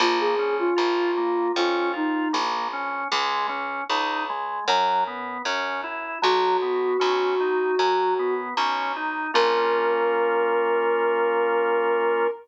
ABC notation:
X:1
M:4/4
L:1/16
Q:1/4=77
K:Bbm
V:1 name="Ocarina"
F A2 F5 F2 E2 z4 | z16 | G12 z4 | B16 |]
V:2 name="Drawbar Organ"
B,2 D2 F2 B,2 D2 F2 B,2 D2 | A,2 D2 E2 A,2 G,2 _C2 D2 _F2 | G,2 _C2 D2 E2 G,2 C2 D2 E2 | [B,DF]16 |]
V:3 name="Electric Bass (finger)" clef=bass
B,,,4 B,,,4 F,,4 B,,,4 | D,,4 D,,4 G,,4 G,,4 | _C,,4 C,,4 G,,4 C,,4 | B,,,16 |]